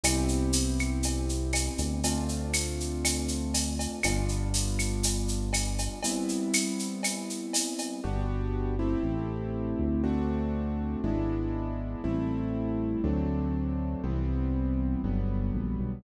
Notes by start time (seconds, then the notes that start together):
0.03 C2 B3 C4 E4 G4, cowbell, claves, shaker
0.28 shaker
0.53 tambourine, shaker
0.79 claves, shaker
1.03 cowbell, shaker
1.29 shaker
1.53 tambourine, cowbell, claves, shaker
1.78 D2, cowbell, shaker
2.03 A3 C4 D4 F4, cowbell, shaker
2.29 shaker
2.53 tambourine, claves, shaker
2.80 shaker
3.05 cowbell, claves, shaker
3.28 shaker
3.54 tambourine, cowbell, shaker
3.79 cowbell, shaker
4.03 G1 G3 B3 D4 F4, cowbell, claves, shaker
4.29 shaker
4.54 tambourine, shaker
4.79 claves, shaker
5.03 cowbell, shaker
5.28 shaker
5.53 tambourine, cowbell, claves, shaker
5.78 cowbell, shaker
6.03 G3 B3 C4 E4, cowbell, shaker
6.29 shaker
6.53 tambourine, claves, shaker
6.79 shaker
7.03 cowbell, claves, shaker
7.30 shaker
7.53 tambourine, cowbell, shaker
7.78 cowbell, shaker
8.04 G1 B3 D4 F#4 G4
8.79 A3 C4 E4 G4
9.03 A1
9.79 D2
10.04 A3 C4 D4 F#4
11.04 G#1 G#3 B3 D4 E4
12.04 A1 G3 A3 C4 E4
13.04 D2 F#3 A3 C4 D4
14.04 C2 E3 G3 B3 C4
15.04 G1 D3 F#3 G3 B3
15.54 A#1
15.79 B1